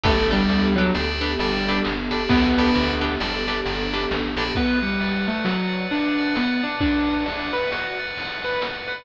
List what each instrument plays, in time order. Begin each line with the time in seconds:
0.03 electric bass (finger) G1, acoustic grand piano A3, pad 2 (warm) B3 D4 G4 A4, acoustic guitar (steel) D4 G4 A4 B4, electric piano 2 D5 G5 A5 B5, kick, ride
0.31 acoustic grand piano G3, acoustic guitar (steel) D4 G4 A4 B4, electric piano 2 D5 G5 A5 B5, ride
0.49 electric bass (finger) D2, ride
0.76 acoustic grand piano F#3, acoustic guitar (steel) D4 G4 A4 B4, ride
0.94 electric bass (finger) D2, electric piano 2 D5 G5 A5 B5, snare
1.21 acoustic guitar (steel) D4 G4 A4 B4, ride
1.39 electric bass (finger) G1, acoustic grand piano G3, electric piano 2 D5 G5 A5 B5, ride
1.67 acoustic guitar (steel) D4 G4 A4 B4, ride
1.85 electric bass (finger) G1, snare, ride
2.11 acoustic guitar (steel) D4 G4 A4 B4, electric piano 2 D5 G5 A5 B5, ride
2.29 electric bass (finger) D2, acoustic grand piano B3, kick, ride
2.57 acoustic guitar (steel) D4 G4 A4 B4, electric piano 2 D5 G5 A5 B5, ride
2.75 electric bass (finger) D2, ride
3.01 acoustic guitar (steel) D4 G4 A4 B4, ride
3.20 electric bass (finger) G1, electric piano 2 D5 G5 A5 B5, snare
3.47 acoustic guitar (steel) D4 G4 A4 B4, ride
3.66 electric bass (finger) G1, electric piano 2 D5 G5 A5 B5, ride
3.93 acoustic guitar (steel) D4 G4 A4 B4, ride
4.11 electric bass (finger) A1, snare
4.36 electric bass (finger) A#1, acoustic guitar (steel) D4 G4 A4 B4, electric piano 2 D5 G5 A5 B5, ride
4.55 acoustic grand piano B3, electric piano 2 B4, kick, ride
4.82 acoustic grand piano G3, electric piano 2 F#5, ride
5.00 electric piano 2 D5, ride
5.28 acoustic grand piano A3, electric piano 2 F#5, ride
5.44 acoustic grand piano F#3, electric piano 2 B4, snare
5.73 electric piano 2 F#5, ride
5.91 acoustic grand piano D4, electric piano 2 F#5, ride
6.18 electric piano 2 D5, ride
6.35 acoustic grand piano B3, electric piano 2 B4, snare
6.63 acoustic grand piano D4, electric piano 2 F#5, ride
6.80 acoustic grand piano D4, electric piano 2 D5, kick, ride
7.08 electric piano 2 F#5, ride
7.26 acoustic grand piano D4, electric piano 2 B4, ride
7.53 acoustic grand piano B4, electric piano 2 F#5, ride
7.72 acoustic grand piano F#4, electric piano 2 F#5, snare
7.99 electric piano 2 D5, ride
8.16 electric piano 2 B4, ride
8.43 acoustic grand piano B4, electric piano 2 F#5, ride
8.62 electric piano 2 D5, snare
8.88 acoustic grand piano B4, electric piano 2 F#5, ride